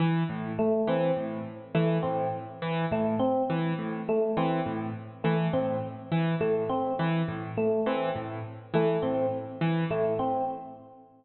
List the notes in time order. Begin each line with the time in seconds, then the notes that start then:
0.00 E3
0.29 A2
0.59 A3
0.87 E3 C4
1.16 A2
1.75 E3 A3
2.03 A2 C4
2.62 E3
2.91 A2 A3
3.19 C4
3.50 E3
3.79 A2
4.09 A3
4.37 E3 C4
4.66 A2
5.24 E3 A3
5.53 A2 C4
6.12 E3
6.41 A2 A3
6.69 C4
6.99 E3
7.28 A2
7.57 A3
7.86 E3 C4
8.16 A2
8.74 E3 A3
9.02 A2 C4
9.61 E3
9.90 A2 A3
10.19 C4